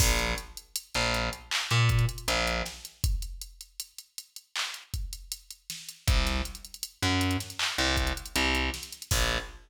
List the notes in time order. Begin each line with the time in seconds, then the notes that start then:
0.00 A#1, kick, crash
0.19 closed hi-hat
0.38 closed hi-hat
0.57 closed hi-hat
0.76 closed hi-hat
0.94 A#1, closed hi-hat
1.14 closed hi-hat
1.33 closed hi-hat
1.51 clap
1.71 A#2, closed hi-hat
1.89 kick, closed hi-hat
1.99 closed hi-hat
2.09 closed hi-hat
2.18 closed hi-hat
2.28 A#1, closed hi-hat
2.47 closed hi-hat
2.66 snare, closed hi-hat
2.85 closed hi-hat
3.04 kick, closed hi-hat
3.22 closed hi-hat
3.41 closed hi-hat
3.61 closed hi-hat
3.80 closed hi-hat
3.98 closed hi-hat
4.18 closed hi-hat
4.36 closed hi-hat
4.56 clap
4.74 closed hi-hat
4.94 kick, closed hi-hat
5.13 closed hi-hat
5.32 closed hi-hat
5.50 closed hi-hat
5.70 snare, closed hi-hat
5.89 closed hi-hat
6.07 C2, kick, closed hi-hat
6.27 snare, closed hi-hat
6.45 closed hi-hat
6.55 closed hi-hat
6.65 closed hi-hat
6.74 closed hi-hat
6.83 closed hi-hat
7.03 F#2, closed hi-hat
7.21 closed hi-hat
7.31 closed hi-hat
7.40 snare, closed hi-hat
7.50 closed hi-hat
7.59 clap
7.78 C2, closed hi-hat
7.97 kick, closed hi-hat
8.07 closed hi-hat
8.17 closed hi-hat
8.26 closed hi-hat
8.36 C2, closed hi-hat
8.55 closed hi-hat
8.74 snare, closed hi-hat
8.83 closed hi-hat
8.92 closed hi-hat
9.02 closed hi-hat
9.11 A#1, kick, crash